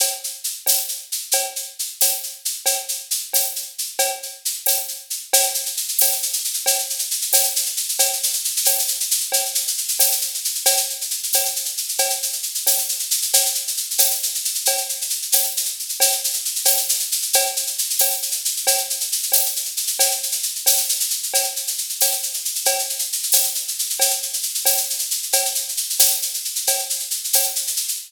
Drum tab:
TB |------x-----|------x-----|------x-----|------x-----|
SH |x-x-x-x-x-x-|x-x-x-x-x-x-|x-x-x-x-x-x-|x-x-x-x-x-x-|
CB |x-----x-----|x-----x-----|x-----x-----|x-----x-----|

TB |------x-----|------x-----|------x-----|------x-----|
SH |xxxxxxxxxxxx|xxxxxxxxxxxx|xxxxxxxxxxxx|xxxxxxxxxxxx|
CB |x-----x-----|x-----x-----|x-----x-----|x-----x-----|

TB |------x-----|------x-----|------x-----|------x-----|
SH |xxxxxxxxxxxx|xxxxxxxxxxxx|xxxxxxxxxxxx|xxxxxxxxxxxx|
CB |x-----x-----|x-----x-----|x-----x-----|x-----x-----|

TB |------x-----|------x-----|------x-----|------x-----|
SH |xxxxxxxxxxxx|xxxxxxxxxxxx|xxxxxxxxxxxx|xxxxxxxxxxxx|
CB |x-----x-----|x-----x-----|x-----x-----|x-----x-----|

TB |------x-----|------x-----|------x-----|------x-----|
SH |xxxxxxxxxxxx|xxxxxxxxxxxx|xxxxxxxxxxxx|xxxxxxxxxxxx|
CB |x-----x-----|x-----x-----|x-----x-----|x-----x-----|

TB |------x-----|
SH |xxxxxxxxxxxx|
CB |x-----x-----|